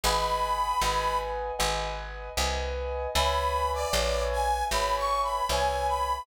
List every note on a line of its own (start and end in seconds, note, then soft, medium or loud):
0.04 0.74 G#1 medium
0.04 0.74 B4 loud
0.04 0.74 D#5 loud
0.04 0.74 F#5 loud
0.04 0.74 G#5 loud
0.04 1.18 B5 loud
0.81 1.52 G#1 medium
0.81 1.52 B4 loud
0.81 1.52 D#5 medium
0.81 1.52 F#5 medium
0.81 1.52 G#5 loud
1.59 2.30 G#1 medium
1.59 2.29 B4 loud
1.59 2.29 D#5 medium
1.59 2.29 F#5 medium
1.59 2.29 G#5 medium
2.37 3.07 C2 medium
2.37 3.07 B4 medium
2.37 3.07 D#5 loud
2.37 3.07 F#5 medium
2.37 3.07 G#5 loud
3.15 3.85 C#2 medium
3.15 3.86 B4 loud
3.15 3.86 C#5 loud
3.15 3.86 E5 loud
3.15 3.86 G#5 loud
3.15 3.71 B5 loud
3.74 4.24 D5 loud
3.93 4.63 A#1 medium
3.93 4.63 B4 medium
3.93 4.63 C#5 loud
3.93 4.63 E5 medium
3.93 4.63 G#5 medium
4.32 4.64 G#5 loud
4.71 5.41 G#1 medium
4.71 5.42 B4 medium
4.71 5.42 C#5 medium
4.71 5.42 E5 medium
4.71 5.42 G#5 medium
4.71 4.96 B5 loud
4.97 5.22 C#6 loud
5.23 5.48 B5 medium
5.49 6.19 C2 medium
5.49 6.20 B4 medium
5.49 6.20 C#5 loud
5.49 6.20 E5 medium
5.49 5.87 G#5 loud
5.49 6.20 G#5 medium
5.88 6.23 B5 loud